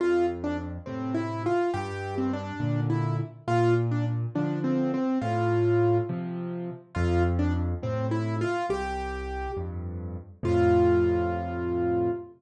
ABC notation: X:1
M:6/8
L:1/16
Q:3/8=69
K:F
V:1 name="Acoustic Grand Piano"
F2 z D z2 C2 E2 F2 | G3 C D4 E2 z2 | F2 z D z2 D2 C2 C2 | F6 z6 |
F2 z D z2 C2 E2 F2 | G6 z6 | F12 |]
V:2 name="Acoustic Grand Piano" clef=bass
F,,6 [A,,C,]6 | G,,6 [B,,D,]6 | B,,6 [D,F,]6 | A,,6 [C,F,]6 |
F,,6 [A,,C,]6 | C,,6 [F,,G,,]6 | [F,,A,,C,]12 |]